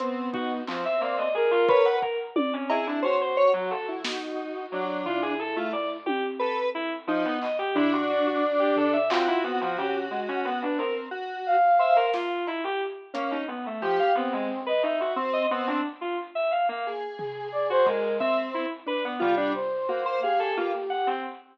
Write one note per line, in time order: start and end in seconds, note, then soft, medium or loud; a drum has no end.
0.00 0.61 B3 medium
0.00 0.30 C4 medium
0.00 closed hi-hat medium
0.33 0.63 D#4 soft
0.33 0.49 F#4 medium
0.33 kick medium
0.67 0.83 F3 medium
0.67 1.29 C4 medium
0.67 clap medium
0.85 1.00 E5 medium
1.01 1.16 A#3 medium
1.01 1.31 D5 medium
1.18 1.33 D#5 medium
1.34 1.50 G#4 loud
1.34 1.96 A#4 loud
1.51 1.66 F4 loud
1.68 1.99 B4 loud
1.68 1.83 C#5 medium
1.68 kick medium
1.85 2.00 F#5 medium
2.02 2.17 A#4 medium
2.02 kick medium
2.36 2.51 D5 loud
2.36 high tom loud
2.53 2.68 C#4 medium
2.70 3.00 E4 medium
2.70 2.85 G#4 medium
2.70 cowbell loud
2.87 3.02 D4 medium
3.02 4.85 F#4 medium
3.02 3.18 C5 medium
3.02 3.19 C#5 medium
3.21 3.36 C5 medium
3.37 3.52 C#5 loud
3.54 3.69 F#3 loud
3.70 3.86 A4 medium
3.88 4.04 E4 soft
4.04 4.66 D#4 medium
4.04 snare loud
4.72 5.02 F#3 medium
4.72 5.34 D4 medium
5.06 5.97 E4 medium
5.06 5.21 F4 medium
5.06 floor tom medium
5.22 5.37 G#4 medium
5.39 5.54 A4 medium
5.56 5.71 A3 medium
5.56 5.72 F4 medium
5.73 5.88 D5 medium
6.06 6.21 G4 loud
6.06 high tom medium
6.39 6.55 A4 medium
6.39 6.70 B4 loud
6.75 6.90 E4 loud
7.07 7.22 F3 medium
7.07 7.39 D#4 loud
7.25 7.40 B3 loud
7.42 7.57 D#5 medium
7.42 clap medium
7.59 7.74 G4 loud
7.75 8.97 D4 loud
7.75 7.91 E4 loud
7.75 floor tom medium
7.92 8.07 F#4 medium
8.09 8.24 F#4 medium
8.09 9.01 D5 medium
8.26 8.41 F#4 medium
8.59 8.75 G4 medium
8.76 8.92 A4 medium
8.76 floor tom medium
8.93 9.08 E5 medium
9.10 9.26 C4 medium
9.10 9.40 F4 medium
9.10 10.63 F#4 medium
9.10 clap loud
9.28 9.43 E4 loud
9.44 9.59 B3 loud
9.44 9.60 C4 medium
9.61 9.76 F3 medium
9.78 10.08 C#4 medium
9.78 9.93 G4 medium
9.78 floor tom medium
10.11 10.26 G#3 soft
10.28 10.44 C#4 medium
10.45 10.60 B3 medium
10.62 10.78 D4 medium
10.62 10.77 B4 medium
10.79 11.09 C4 medium
10.79 10.94 A#4 medium
11.11 11.57 F#4 medium
11.46 12.07 F5 medium
11.79 12.10 C5 medium
11.79 11.95 E5 medium
11.96 12.12 A#4 loud
12.13 12.44 F4 medium
12.13 snare medium
12.47 12.62 E4 medium
12.47 cowbell medium
12.64 12.79 G4 loud
13.14 13.30 A#3 medium
13.14 13.44 C#4 medium
13.14 closed hi-hat medium
13.31 13.46 D#4 medium
13.48 13.63 B3 medium
13.66 13.81 A3 medium
13.81 13.97 F3 medium
13.81 14.12 G4 medium
13.81 14.12 G4 loud
13.99 14.14 F5 loud
14.15 14.30 B3 loud
14.15 14.61 C4 loud
14.33 14.48 G#3 medium
14.66 14.82 B4 medium
14.66 14.82 D#5 medium
14.82 14.98 D#4 medium
14.82 15.13 E5 medium
15.00 15.15 F#4 medium
15.16 15.47 C4 loud
15.33 15.48 D#5 loud
15.51 15.66 B3 loud
15.51 15.81 C4 loud
15.67 15.82 D4 medium
16.01 16.16 F4 medium
16.35 16.50 E5 medium
16.51 16.66 F5 medium
16.69 16.84 A#3 loud
16.87 18.08 G#4 medium
17.18 17.48 G#4 medium
17.18 floor tom medium
17.52 17.67 D5 medium
17.70 17.85 F#4 medium
17.70 17.86 C5 loud
17.86 18.16 G#3 medium
17.86 18.17 A#4 medium
17.86 kick medium
18.20 18.66 C4 loud
18.20 18.35 E5 loud
18.20 kick medium
18.54 18.69 E4 medium
18.86 19.17 D4 medium
18.86 19.03 B4 loud
19.05 19.20 B3 loud
19.20 19.52 G3 loud
19.20 19.35 F4 loud
19.20 floor tom medium
19.37 19.53 D4 loud
19.54 20.15 C5 medium
19.88 20.19 A#3 medium
19.88 20.04 F#4 medium
20.06 20.21 C5 loud
20.22 21.13 G4 soft
20.22 20.54 G#4 medium
20.22 20.37 F5 medium
20.39 20.55 A4 medium
20.57 20.72 A#3 medium
20.57 20.72 F4 medium
20.90 21.05 F#5 loud
21.07 21.22 C4 medium